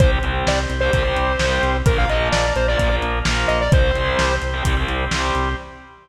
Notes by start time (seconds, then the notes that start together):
0.00 C2 G3 C4 G4 C5, kick, closed hi-hat
0.23 C2 G3 C4, closed hi-hat
0.47 C2 D5, snare
0.70 C2, closed hi-hat
0.80 G3 C4 C5
0.93 C2 G3 C4, kick, closed hi-hat
1.04 G3 C4
1.16 C2, closed hi-hat
1.39 C2 G3 C4, snare
1.63 C2, closed hi-hat
1.86 A#1 F3 A#3 F4 A#4, kick, closed hi-hat
1.98 F5
2.09 A#1 F3 A#3 D#5, closed hi-hat
2.32 A#1 D5, snare
2.56 A#1 C5, closed hi-hat
2.68 F3 A#3 D5
2.79 A#1 F3 A#3, kick, closed hi-hat
2.91 F3 A#3
3.02 A#1, closed hi-hat
3.25 A#1 F3 A#3, snare
3.48 A#1 D#5, closed hi-hat
3.61 D5
3.72 C2 G3 C4 G4 C5, kick, closed hi-hat
3.95 C2 G3 C4, closed hi-hat
4.19 C2, snare
4.42 C2, closed hi-hat
4.53 G3 C4
4.65 C2 G3 C4, kick, closed hi-hat
4.77 G3 C4
4.88 C2, closed hi-hat
5.11 C2 G3 C4, snare
5.35 C2, closed hi-hat